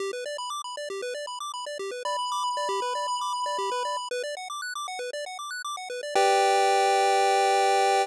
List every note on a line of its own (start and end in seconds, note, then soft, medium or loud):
0.00 0.11 G4 medium
0.13 0.24 B4 medium
0.26 0.37 D5 medium
0.38 0.50 B5 medium
0.50 0.62 D6 medium
0.64 0.76 B5 medium
0.77 0.89 D5 medium
0.90 1.01 G4 medium
1.02 1.14 B4 medium
1.14 1.26 D5 medium
1.27 1.39 B5 medium
1.40 1.52 D6 medium
1.54 1.65 B5 medium
1.66 1.78 D5 medium
1.79 1.91 G4 medium
1.91 2.03 B4 medium
2.05 2.17 D5 medium
2.05 3.98 B5 medium
2.19 2.30 B5 medium
2.32 2.43 D6 medium
2.44 2.55 B5 medium
2.57 2.68 D5 medium
2.69 2.80 G4 medium
2.82 2.93 B4 medium
2.95 3.07 D5 medium
3.08 3.19 B5 medium
3.21 3.33 D6 medium
3.33 3.45 B5 medium
3.46 3.57 D5 medium
3.58 3.70 G4 medium
3.72 3.83 B4 medium
3.85 3.96 D5 medium
3.97 4.08 B5 medium
4.11 4.23 B4 medium
4.24 4.35 D5 medium
4.37 4.48 F#5 medium
4.50 4.61 D6 medium
4.62 4.74 F#6 medium
4.75 4.87 D6 medium
4.88 4.99 F#5 medium
4.99 5.11 B4 medium
5.13 5.25 D5 medium
5.26 5.38 F#5 medium
5.39 5.50 D6 medium
5.51 5.62 F#6 medium
5.65 5.76 D6 medium
5.77 5.89 F#5 medium
5.90 6.01 B4 medium
6.03 6.14 D5 medium
6.15 8.06 G4 loud
6.15 8.06 B4 medium
6.15 8.06 D5 medium
6.15 8.06 G5 loud